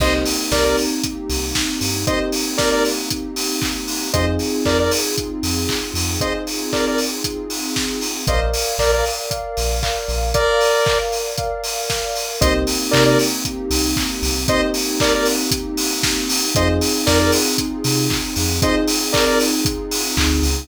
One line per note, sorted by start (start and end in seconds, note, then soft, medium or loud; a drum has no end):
0.00 0.23 C2 medium
0.00 4.10 A#3 medium
0.00 1.87 A#3 medium
0.00 4.10 C4 medium
0.00 1.87 C4 medium
0.00 4.10 D#4 medium
0.00 1.87 D#4 medium
0.00 4.10 G4 medium
0.00 1.87 G4 medium
0.00 0.13 C5 medium
0.00 0.13 D#5 medium
0.00 kick loud
0.00 crash loud
0.26 open hi-hat medium
0.52 0.75 C2 medium
0.52 0.64 A#4 medium
0.52 0.64 D5 medium
0.52 kick medium
0.52 snare loud
0.64 0.77 A#4 medium
0.64 0.77 D5 medium
0.77 open hi-hat medium
1.03 kick medium
1.03 closed hi-hat loud
1.29 1.53 C2 medium
1.29 open hi-hat medium
1.55 kick medium
1.55 snare loud
1.81 2.04 G2 medium
1.81 open hi-hat medium
2.07 3.93 A#3 medium
2.07 3.93 C4 medium
2.07 3.93 D#4 medium
2.07 3.93 G4 medium
2.07 2.19 C5 medium
2.07 2.19 D#5 medium
2.07 kick loud
2.07 closed hi-hat loud
2.32 open hi-hat medium
2.58 2.70 A#4 medium
2.58 2.70 D5 medium
2.58 kick medium
2.58 snare loud
2.71 2.84 A#4 medium
2.71 2.84 D5 medium
2.85 open hi-hat medium
3.10 kick medium
3.10 closed hi-hat loud
3.36 open hi-hat medium
3.62 kick loud
3.62 clap loud
3.88 open hi-hat medium
4.13 4.38 F2 medium
4.13 6.00 C4 medium
4.13 8.24 C4 medium
4.13 6.00 D#4 medium
4.13 8.24 D#4 medium
4.13 6.00 F4 medium
4.13 8.24 F4 medium
4.13 6.00 G#4 medium
4.13 8.24 G#4 medium
4.13 4.26 C5 medium
4.13 4.26 D#5 medium
4.13 kick loud
4.13 closed hi-hat loud
4.39 open hi-hat medium
4.65 4.89 F2 medium
4.65 4.78 A#4 medium
4.65 4.78 D5 medium
4.65 kick medium
4.65 clap loud
4.79 4.92 A#4 medium
4.79 4.92 D5 medium
4.91 open hi-hat loud
5.18 kick medium
5.18 closed hi-hat loud
5.43 5.66 F2 medium
5.43 open hi-hat medium
5.69 kick medium
5.69 clap loud
5.94 6.17 F2 medium
5.94 open hi-hat medium
6.20 8.07 C4 medium
6.20 8.07 D#4 medium
6.20 8.07 F4 medium
6.20 8.07 G#4 medium
6.20 6.33 C5 medium
6.20 6.33 D#5 medium
6.20 kick loud
6.20 closed hi-hat loud
6.47 open hi-hat medium
6.73 6.85 A#4 medium
6.73 6.85 D5 medium
6.73 kick medium
6.73 clap loud
6.87 6.99 A#4 medium
6.87 6.99 D5 medium
6.98 open hi-hat medium
7.24 kick medium
7.24 closed hi-hat loud
7.50 open hi-hat medium
7.76 kick medium
7.76 snare loud
8.01 open hi-hat medium
8.27 8.52 A#1 medium
8.27 8.74 A#4 medium
8.27 12.37 A#4 medium
8.27 8.40 C5 medium
8.27 8.74 D5 medium
8.27 12.37 D5 medium
8.27 8.40 D#5 medium
8.27 8.74 F5 medium
8.27 12.37 F5 medium
8.27 kick loud
8.27 closed hi-hat loud
8.54 open hi-hat medium
8.78 9.02 A#1 medium
8.78 8.91 A#4 medium
8.78 9.26 A#4 medium
8.78 8.91 D5 medium
8.78 9.26 D5 medium
8.78 9.26 F5 medium
8.78 kick medium
8.78 clap loud
8.92 9.05 A#4 medium
8.92 9.05 D5 medium
9.05 open hi-hat medium
9.30 9.77 A#4 medium
9.30 9.77 D5 medium
9.30 9.77 F5 medium
9.30 kick medium
9.30 closed hi-hat loud
9.57 9.81 A#1 medium
9.57 open hi-hat medium
9.83 10.29 A#4 medium
9.83 10.29 D5 medium
9.83 10.29 F5 medium
9.83 kick medium
9.83 clap loud
10.08 10.32 A#1 medium
10.08 open hi-hat medium
10.34 10.98 A#4 medium
10.34 10.81 A#4 medium
10.34 10.98 D5 medium
10.34 10.81 D5 medium
10.34 10.81 F5 medium
10.34 kick loud
10.34 closed hi-hat loud
10.61 open hi-hat medium
10.86 11.33 A#4 medium
10.86 11.33 D5 medium
10.86 11.33 F5 medium
10.86 kick loud
10.86 clap loud
11.12 open hi-hat medium
11.37 11.85 A#4 medium
11.37 11.85 D5 medium
11.37 11.85 F5 medium
11.37 kick loud
11.37 closed hi-hat loud
11.64 open hi-hat medium
11.89 12.36 A#4 medium
11.89 12.36 D5 medium
11.89 12.36 F5 medium
11.89 kick medium
11.89 snare loud
12.16 open hi-hat medium
12.41 12.65 C2 loud
12.41 16.51 A#3 medium
12.41 14.27 A#3 loud
12.41 16.51 C4 medium
12.41 14.27 C4 medium
12.41 16.51 D#4 medium
12.41 14.27 D#4 medium
12.41 16.51 G4 medium
12.41 14.27 G4 medium
12.41 12.53 C5 medium
12.41 12.53 D#5 medium
12.41 kick loud
12.41 closed hi-hat loud
12.67 open hi-hat medium
12.91 13.16 C3 medium
12.91 13.04 A#4 medium
12.91 13.04 D5 medium
12.91 kick medium
12.91 clap loud
13.06 13.18 A#4 medium
13.06 13.18 D5 medium
13.19 open hi-hat medium
13.45 kick medium
13.45 closed hi-hat loud
13.70 13.94 C2 medium
13.70 open hi-hat loud
13.96 kick loud
13.96 clap loud
14.22 14.46 C2 medium
14.22 open hi-hat medium
14.48 16.34 A#3 medium
14.48 16.34 C4 medium
14.48 16.34 D#4 medium
14.48 16.34 G4 medium
14.48 14.61 C5 medium
14.48 14.61 D#5 medium
14.48 kick loud
14.48 closed hi-hat loud
14.74 open hi-hat medium
15.00 15.13 A#4 medium
15.00 15.13 D5 medium
15.00 kick loud
15.00 clap loud
15.15 15.27 A#4 medium
15.15 15.27 D5 medium
15.25 open hi-hat medium
15.51 kick loud
15.51 closed hi-hat loud
15.77 open hi-hat loud
16.03 kick loud
16.03 snare loud
16.29 open hi-hat loud
16.55 16.80 F2 medium
16.55 20.65 C4 medium
16.55 18.42 C4 medium
16.55 20.65 D#4 loud
16.55 18.42 D#4 medium
16.55 20.65 F4 medium
16.55 18.42 F4 medium
16.55 20.65 G#4 medium
16.55 18.42 G#4 medium
16.55 16.68 C5 medium
16.55 16.68 D#5 medium
16.55 kick loud
16.55 closed hi-hat loud
16.81 open hi-hat loud
17.06 17.30 F2 medium
17.06 17.19 A#4 medium
17.06 17.19 D5 medium
17.06 kick loud
17.06 snare loud
17.19 17.32 A#4 medium
17.19 17.32 D5 medium
17.32 open hi-hat loud
17.58 kick medium
17.58 closed hi-hat loud
17.84 18.08 C3 medium
17.84 open hi-hat loud
18.10 kick loud
18.10 clap loud
18.36 18.60 F2 medium
18.36 open hi-hat medium
18.62 20.48 C4 medium
18.62 20.48 D#4 medium
18.62 20.48 F4 medium
18.62 20.48 G#4 medium
18.62 18.75 C5 medium
18.62 18.75 D#5 medium
18.62 kick loud
18.62 closed hi-hat loud
18.87 open hi-hat loud
19.13 19.25 A#4 medium
19.13 19.25 D5 medium
19.13 kick loud
19.13 clap loud
19.27 19.39 A#4 medium
19.27 19.39 D5 medium
19.40 open hi-hat loud
19.65 kick loud
19.65 closed hi-hat loud
19.91 open hi-hat loud
20.17 20.41 D2 medium
20.17 kick loud
20.17 clap loud
20.43 20.66 C#2 medium
20.43 open hi-hat medium